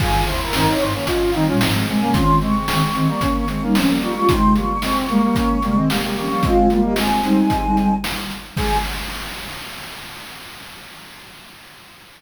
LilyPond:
<<
  \new Staff \with { instrumentName = "Choir Aahs" } { \time 4/4 \key aes \major \tempo 4 = 112 aes'8 c''16 bes'16 bes'16 des''16 c''16 des''16 ees''16 f''16 g''16 r8. aes''8 | c'''8 des'''16 des'''16 des'''16 des'''16 des'''16 des'''16 des'''16 des'''16 des'''16 r8. des'''8 | c'''8 des'''16 des'''16 des'''16 des'''16 des'''16 des'''16 des'''16 des'''16 des'''16 r8. des'''8 | f''8. ees''16 aes''2 r4 |
aes''4 r2. | }
  \new Staff \with { instrumentName = "Brass Section" } { \time 4/4 \key aes \major <f' aes'>8 fes'8 <c' ees'>8 <c' ees'>16 <bes des'>16 <des' f'>8 <c' ees'>16 <des' f'>16 <c' ees'>16 <aes c'>16 <aes c'>16 <bes des'>16 | <des' f'>8 <aes c'>8 <aes c'>8 <aes c'>16 <g bes>16 <bes des'>8 <aes c'>16 <bes des'>16 <aes c'>16 <g bes>16 <g bes>16 <g bes>16 | <c' ees'>8 <g bes>8 <aes c'>8 <g bes>16 <g bes>16 <bes des'>8 <g bes>16 <aes c'>16 <g bes>16 <g bes>16 <g bes>16 <g bes>16 | <aes c'>8 <g bes>8 <aes c'>8 <aes c'>4. r4 |
aes'4 r2. | }
  \new Staff \with { instrumentName = "Ocarina" } { \time 4/4 \key aes \major <g, ees>8 <ees, c>16 r16 <g, ees>16 r16 <g, ees>16 r8. <g, ees>16 <bes, g>16 <aes, f>8 <c aes>16 <c aes>16 | <ees c'>8 <c aes>16 r16 <ees c'>16 r16 <ees c'>16 r8. <ees c'>16 <g ees'>16 <f des'>8 <aes f'>16 <aes f'>16 | <c aes>8 <aes, f>16 r16 <c aes>16 r16 <c aes>16 r8. <c aes>16 <ees c'>16 <c aes>8 <f des'>16 <f des'>16 | <aes f'>8 <aes f'>16 <bes g'>16 r8 <g ees'>4. r4 |
aes4 r2. | }
  \new DrumStaff \with { instrumentName = "Drums" } \drummode { \time 4/4 <cymc bd>8 hh8 sn8 hh8 <hh bd>8 hh8 sn8 hh8 | <hh bd>8 hh8 sn8 hh8 <hh bd>8 hh8 sn8 hh8 | <hh bd>8 hh8 sn8 hh8 <hh bd>8 hh8 sn8 hho8 | <hh bd>8 hh8 sn8 hh8 <hh bd>8 hh8 sn8 hh8 |
<cymc bd>4 r4 r4 r4 | }
>>